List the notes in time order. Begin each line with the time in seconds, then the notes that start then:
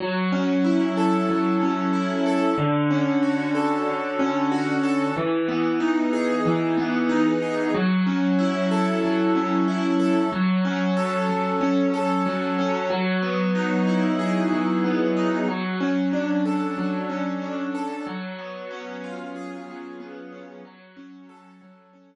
0.00 F#3
0.32 C#4
0.64 E4
0.97 A4
1.29 F#3
1.61 C#4
1.93 E4
2.26 A4
2.58 D3
2.90 C#4
3.23 F#4
3.55 A4
3.87 D3
4.19 C#4
4.52 F#4
4.83 A4
5.17 E3
5.48 B3
5.80 D#4
6.13 G#4
6.46 E3
6.77 B3
7.09 D#4
7.42 G#4
7.74 F#3
8.07 C#4
8.39 E4
8.71 A4
9.03 F#3
9.35 C#4
9.68 E4
10.00 A4
10.32 F#3
10.65 C#4
10.97 A4
11.29 F#3
11.61 C#4
11.94 A4
12.26 F#3
12.59 C#4
12.90 F#3
13.22 B3
13.55 D#4
13.87 E4
14.19 G#4
14.52 F#3
14.84 B3
15.17 D#4
15.48 F#3
15.81 C#4
16.13 D4
16.45 A4
16.78 F#3
17.09 C#4
17.42 D4
17.75 A4
18.07 F#3
18.39 B3
18.71 C#4
19.04 F4
19.36 G#4
19.68 F#3
20.00 B3
20.32 C#4
20.65 F#3
20.97 C#4
21.29 A4
21.61 F#3
21.93 C#4